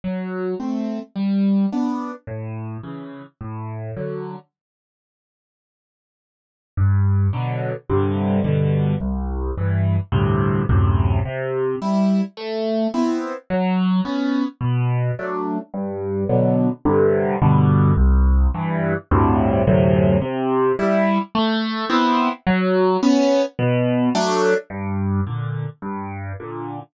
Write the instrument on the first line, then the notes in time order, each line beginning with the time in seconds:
acoustic grand piano
0.04 F#3
0.59 A3 C4
1.15 G3
1.72 B3 D4
2.27 A2
2.83 C#3 E3
3.41 A2
3.96 D3 F#3
6.77 G2
7.33 B2 D3 F#3
7.89 G2 C3 D3
8.44 G2 B2 D3
9.00 C2
9.57 G2 E3
10.12 D2 G2 A2 C3
10.69 D2 F#2 A2 C3
11.25 C3
11.82 G3 E4
12.37 A3
12.94 B3 C4 E4
13.50 F#3
14.05 B3 C#4
14.61 B2
15.19 F#3 A3 D4
15.73 G2
16.29 B2 D3 F#3
16.85 G2 C3 D3
17.42 G2 B2 D3
17.97 C2
18.54 G2 E3
19.11 D2 G2 A2 C3
19.67 D2 F#2 A2 C3
20.21 C3
20.79 G3 E4
21.35 A3
21.89 B3 C4 E4
22.46 F#3
23.03 B3 C#4
23.59 B2
24.14 F#3 A3 D4
24.70 G2
25.26 A#2 D3
25.82 G2
26.40 A#2 D3